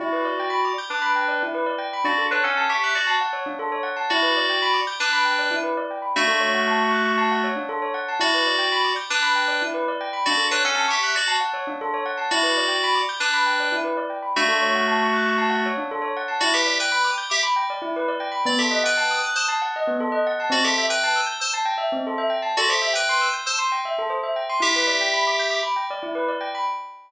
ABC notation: X:1
M:4/4
L:1/16
Q:1/4=117
K:Em
V:1 name="Electric Piano 2"
[Fd]6 z [DB]5 z4 | [Fd]2 [DB] [^CA]2 [Ge]2 [Fd]2 z7 | [Fd]6 z [DB]5 z4 | [A,F]12 z4 |
[Fd]6 z [DB]5 z4 | [Fd]2 [DB] [^CA]2 [Ge]2 [Fd]2 z7 | [Fd]6 z [DB]5 z4 | [A,F]12 z4 |
[Fd] [Ge]2 [Bg]3 z [Ge] z8 | d [Ge]2 [Bg]3 z [ca] z8 | [Fd] [Ge]2 [Bg]3 z [ca] z8 | [Fd] [Ge]2 [Bg]3 z [ca] z8 |
[Ge]8 z8 |]
V:2 name="Tubular Bells"
E B d g b d' g' d' b g d E B d g b | D A ^c f a ^c' f' c' a f c D A c f a | E B d g b d' g' d' b g d E B d g b | D A ^c f a ^c' f' c' a f c D A c f a |
E B d g b d' g' d' b g d E B d g b | D A ^c f a ^c' f' c' a f c D A c f a | E B d g b d' g' d' b g d E B d g b | D A ^c f a ^c' f' c' a f c D A c f a |
E B d g b d' g' d' b g d E B d g b | B, A ^d f a ^d' f' d' a f d B, A d f a | C A e g a e' g' e' a g e C A e g a | A c e g c' e' g' e' c' g e A c e g c' |
E B d g b d' g' d' b g d E B d g b |]